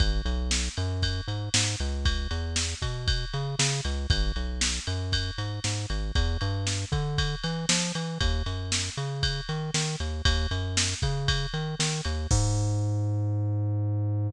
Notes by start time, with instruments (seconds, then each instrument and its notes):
0.00 synth bass 1 G#1, kick, ride
0.25 synth bass 1 B1, ride
0.51 snare
0.77 synth bass 1 F#2, ride
1.02 kick, ride
1.28 synth bass 1 G#2, ride
1.54 synth bass 1 G#2, snare
1.80 synth bass 1 C#2, ride
2.05 kick, ride
2.31 synth bass 1 E2, ride
2.56 snare
2.82 synth bass 1 B2, kick, ride
3.08 kick, ride
3.34 synth bass 1 C#3, ride
3.59 synth bass 1 C#3, snare
3.85 synth bass 1 C#2, ride
4.10 synth bass 1 G#1, kick, ride
4.36 synth bass 1 B1, ride
4.61 snare
4.87 synth bass 1 F#2, ride
5.12 kick, ride
5.38 synth bass 1 G#2, ride
5.64 synth bass 1 G#2, snare
5.90 synth bass 1 G#1, ride
6.15 synth bass 1 E2, kick, ride
6.41 synth bass 1 G2, ride
6.67 snare
6.92 synth bass 1 D3, kick, ride
7.18 kick, ride
7.43 synth bass 1 E3, ride
7.69 synth bass 1 F3, snare
7.95 synth bass 1 E3, ride
8.21 synth bass 1 D#2, kick, ride
8.46 synth bass 1 F#2, ride
8.72 snare
8.97 synth bass 1 C#3, ride
9.23 kick, ride
9.49 synth bass 1 D#3, ride
9.74 synth bass 1 D#3, snare
10.00 synth bass 1 D#2, ride
10.25 synth bass 1 D#2, kick, ride
10.51 synth bass 1 F#2, ride
10.77 snare
11.02 synth bass 1 C#3, kick, ride
11.28 kick, ride
11.54 synth bass 1 D#3, ride
11.79 synth bass 1 D#3, snare
12.05 synth bass 1 D#2, ride
12.31 synth bass 1 G#2, kick, crash